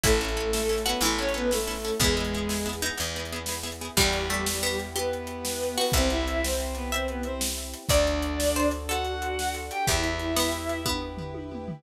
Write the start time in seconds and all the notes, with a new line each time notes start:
0.03 A1 A3 C#4 E4 A4, kick, closed hi-hat
0.20 A3 C#4 E4 A4
0.28 closed hi-hat
0.37 C#4 E4 A4
0.53 A3 C#4 E4 A4, snare
0.69 C#4 E4 A4
0.78 closed hi-hat
0.85 B3 C#4 E4 F#4 A4 B4
1.01 A1 E3 A3 C#4 E4 A4, closed hi-hat
1.18 C#4 E4 A4 C#5
1.29 closed hi-hat
1.34 B3 C#4 E4 A4 B4
1.51 A3 C#4 E4 A4, snare
1.67 C#4 E4 A4
1.75 open hi-hat
1.85 C#4 E4 A4
2.00 E2 G#3 B3 E4 G#4, kick, closed hi-hat
2.17 B3 E4 G#4
2.25 closed hi-hat
2.34 B3 E4 G#4
2.49 B3 E4 G#4, snare
2.66 B3 E4 G#4
2.73 closed hi-hat
2.82 B3 D#4 E4 G#4
2.97 E2 B3 E4 G#4, closed hi-hat
3.16 B3 E4 G#4
3.25 closed hi-hat
3.32 B3 E4 G#4
3.46 B3 E4 G#4, snare
3.63 B3 E4 G#4
3.72 closed hi-hat
3.81 B3 E4 G#4
3.97 E2 G3 B3 E4 G4, kick, crash
4.13 closed hi-hat
4.30 A3, closed hi-hat
4.46 snare
4.63 B3, closed hi-hat
4.79 closed hi-hat
4.96 B3 G4 B4, closed hi-hat
5.13 closed hi-hat
5.27 closed hi-hat
5.45 snare
5.63 closed hi-hat
5.78 B3 F#4 B4, open hi-hat
5.92 C2 C4 E4 G4 C5 E5, kick, closed hi-hat
6.10 E4 E5, closed hi-hat
6.28 closed hi-hat
6.43 C4 C5, snare
6.60 closed hi-hat
6.75 B3 B4, closed hi-hat
6.92 C4 C5 E5, closed hi-hat
7.08 B3 B4, closed hi-hat
7.23 C4 C5, closed hi-hat
7.41 snare
7.58 closed hi-hat
7.74 closed hi-hat
7.89 D2 D4 F#4 A4 D5, kick, closed hi-hat
8.07 closed hi-hat
8.22 closed hi-hat
8.40 snare
8.56 C5, closed hi-hat
8.71 closed hi-hat
8.89 F#4 A4 F#5, closed hi-hat
9.05 closed hi-hat
9.22 closed hi-hat
9.39 snare
9.54 closed hi-hat
9.71 G4 G5, closed hi-hat
9.87 E2 E4 G4 B4 E5, kick, closed hi-hat
10.03 closed hi-hat
10.19 closed hi-hat
10.36 B3, snare
10.52 closed hi-hat
10.69 closed hi-hat
10.85 B3, kick, high tom
11.17 floor tom
11.34 high tom
11.52 mid tom
11.68 floor tom